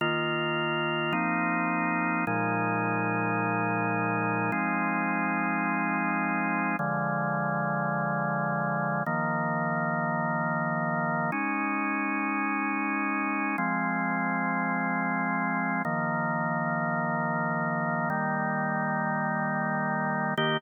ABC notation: X:1
M:4/4
L:1/8
Q:1/4=106
K:Eb
V:1 name="Drawbar Organ"
[E,B,F]4 [F,B,CE]4 | [B,,F,A,E]8 | [F,A,CE]8 | [D,F,A,]8 |
[E,F,B,]8 | [A,_DE]8 | [F,A,C]8 | [E,F,B,]8 |
[E,G,B,]8 | [E,B,G]2 z6 |]